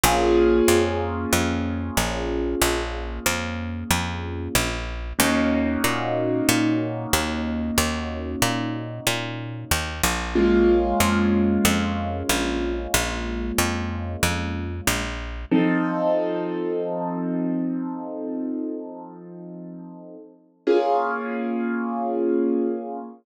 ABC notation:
X:1
M:4/4
L:1/8
Q:1/4=93
K:Bbm
V:1 name="Acoustic Grand Piano"
[B,DFA]8- | [B,DFA]8 | [B,DEG]8- | [B,DEG]8 |
[A,B,DF]8- | [A,B,DF]8 | [F,CE=A]8- | [F,CE=A]8 |
[B,DFA]8 |]
V:2 name="Electric Bass (finger)" clef=bass
B,,,2 F,,2 F,,2 B,,,2 | B,,,2 F,,2 F,,2 B,,,2 | E,,2 B,,2 B,,2 E,,2 | E,,2 B,,2 B,,2 E,, B,,,- |
B,,,2 F,,2 F,,2 B,,,2 | B,,,2 F,,2 F,,2 B,,,2 | z8 | z8 |
z8 |]